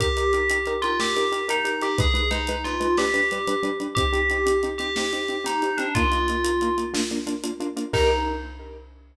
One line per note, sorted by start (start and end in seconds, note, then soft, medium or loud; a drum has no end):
0.00 0.07 D#4 medium
0.00 0.07 G4 medium
0.00 0.71 G4 medium
0.00 0.07 A#4 medium
0.00 kick loud
0.00 closed hi-hat loud
0.17 0.24 D#4 medium
0.17 0.24 G4 medium
0.17 0.24 A#4 medium
0.17 closed hi-hat medium
0.33 0.40 D#4 medium
0.33 0.40 G4 medium
0.33 0.40 A#4 medium
0.33 closed hi-hat medium
0.50 0.57 D#4 medium
0.50 0.57 G4 medium
0.50 0.57 A#4 medium
0.50 closed hi-hat loud
0.66 0.73 D#4 medium
0.66 0.73 G4 medium
0.66 0.73 A#4 medium
0.66 closed hi-hat medium
0.82 0.90 D#4 medium
0.82 0.97 F4 medium
0.82 0.90 G4 medium
0.82 0.90 A#4 medium
0.82 closed hi-hat medium
1.00 1.06 D#4 medium
1.00 1.06 G4 medium
1.00 1.43 G4 medium
1.00 1.06 A#4 medium
1.00 snare loud
1.16 1.23 D#4 medium
1.16 1.23 G4 medium
1.16 1.23 A#4 medium
1.16 closed hi-hat medium
1.32 1.39 D#4 medium
1.32 1.39 G4 medium
1.32 1.39 A#4 medium
1.32 closed hi-hat medium
1.48 1.55 D#4 medium
1.48 1.79 D#4 medium
1.48 1.55 G4 medium
1.48 1.55 A#4 medium
1.48 closed hi-hat loud
1.65 1.71 D#4 medium
1.65 1.71 G4 medium
1.65 1.71 A#4 medium
1.65 closed hi-hat medium
1.81 1.88 D#4 medium
1.81 1.88 G4 medium
1.81 1.96 G4 medium
1.81 1.88 A#4 medium
1.81 closed hi-hat medium
1.98 2.05 G#3 medium
1.98 2.05 D#4 medium
1.98 2.28 G#4 medium
1.98 2.05 B4 medium
1.98 kick loud
1.98 closed hi-hat loud
2.14 2.20 G#3 medium
2.14 2.20 D#4 medium
2.14 2.20 B4 medium
2.14 closed hi-hat medium
2.31 2.38 G#3 medium
2.31 2.61 D#4 medium
2.31 2.38 D#4 medium
2.31 2.38 B4 medium
2.31 closed hi-hat medium
2.47 2.55 G#3 medium
2.47 2.55 D#4 medium
2.47 2.55 B4 medium
2.47 closed hi-hat loud
2.64 2.72 G#3 medium
2.64 2.72 D#4 medium
2.64 2.92 F4 medium
2.64 2.72 B4 medium
2.64 closed hi-hat medium
2.80 2.87 G#3 medium
2.80 2.87 D#4 medium
2.80 2.87 B4 medium
2.80 closed hi-hat medium
2.97 3.05 G3 medium
2.97 3.05 D4 medium
2.97 3.66 G4 medium
2.97 3.05 B4 medium
2.97 snare loud
3.14 3.20 G3 medium
3.14 3.20 D4 medium
3.14 3.20 B4 medium
3.14 closed hi-hat medium
3.31 3.38 G3 medium
3.31 3.38 D4 medium
3.31 3.38 B4 medium
3.31 closed hi-hat medium
3.47 3.54 G3 medium
3.47 3.54 D4 medium
3.47 3.54 B4 medium
3.47 closed hi-hat loud
3.63 3.69 G3 medium
3.63 3.69 D4 medium
3.63 3.69 B4 medium
3.63 closed hi-hat medium
3.80 3.87 G3 medium
3.80 3.87 D4 medium
3.80 3.87 B4 medium
3.80 closed hi-hat medium
3.95 4.04 C4 medium
3.95 4.04 D#4 medium
3.95 4.64 G4 medium
3.95 4.04 G4 medium
3.95 kick loud
3.95 closed hi-hat loud
4.13 4.19 C4 medium
4.13 4.19 D#4 medium
4.13 4.19 G4 medium
4.13 closed hi-hat medium
4.30 4.37 C4 medium
4.30 4.37 D#4 medium
4.30 4.37 G4 medium
4.30 closed hi-hat medium
4.46 4.52 C4 medium
4.46 4.52 D#4 medium
4.46 4.52 G4 medium
4.46 closed hi-hat loud
4.63 4.70 C4 medium
4.63 4.70 D#4 medium
4.63 4.70 G4 medium
4.63 closed hi-hat medium
4.78 4.86 C4 medium
4.78 4.86 D#4 medium
4.78 4.91 G4 medium
4.78 4.86 G4 medium
4.78 closed hi-hat medium
4.96 5.03 C4 medium
4.96 5.03 D#4 medium
4.96 5.03 G4 medium
4.96 5.44 G4 medium
4.96 snare loud
5.13 5.19 C4 medium
5.13 5.19 D#4 medium
5.13 5.19 G4 medium
5.13 closed hi-hat medium
5.28 5.35 C4 medium
5.28 5.35 D#4 medium
5.28 5.35 G4 medium
5.28 closed hi-hat medium
5.44 5.51 C4 medium
5.44 5.51 D#4 medium
5.44 5.76 D#4 medium
5.44 5.51 G4 medium
5.44 closed hi-hat loud
5.62 5.69 C4 medium
5.62 5.69 D#4 medium
5.62 5.69 G4 medium
5.62 closed hi-hat medium
5.77 5.85 C4 medium
5.77 5.92 D4 medium
5.77 5.85 D#4 medium
5.77 5.85 G4 medium
5.77 closed hi-hat medium
5.95 6.02 A#3 medium
5.95 6.02 D#4 medium
5.95 6.76 F4 medium
5.95 6.02 F4 medium
5.95 kick loud
5.95 closed hi-hat loud
6.12 6.18 A#3 medium
6.12 6.18 D#4 medium
6.12 6.18 F4 medium
6.12 closed hi-hat medium
6.28 6.36 A#3 medium
6.28 6.36 D#4 medium
6.28 6.36 F4 medium
6.28 closed hi-hat medium
6.44 6.51 A#3 medium
6.44 6.51 D#4 medium
6.44 6.51 F4 medium
6.44 closed hi-hat loud
6.61 6.68 A#3 medium
6.61 6.68 D#4 medium
6.61 6.68 F4 medium
6.61 closed hi-hat medium
6.78 6.84 A#3 medium
6.78 6.84 D#4 medium
6.78 6.84 F4 medium
6.78 closed hi-hat medium
6.94 7.00 A#3 medium
6.94 7.00 D4 medium
6.94 7.00 F4 medium
6.94 snare loud
7.11 7.18 A#3 medium
7.11 7.18 D4 medium
7.11 7.18 F4 medium
7.11 closed hi-hat medium
7.27 7.33 A#3 medium
7.27 7.33 D4 medium
7.27 7.33 F4 medium
7.27 closed hi-hat medium
7.44 7.50 A#3 medium
7.44 7.50 D4 medium
7.44 7.50 F4 medium
7.44 closed hi-hat loud
7.60 7.67 A#3 medium
7.60 7.67 D4 medium
7.60 7.67 F4 medium
7.60 closed hi-hat medium
7.77 7.83 A#3 medium
7.77 7.83 D4 medium
7.77 7.83 F4 medium
7.77 closed hi-hat medium
7.93 8.11 D#4 medium
7.93 8.11 D#4 loud
7.93 8.11 G4 loud
7.93 8.11 A#4 loud
7.93 kick loud
7.93 crash loud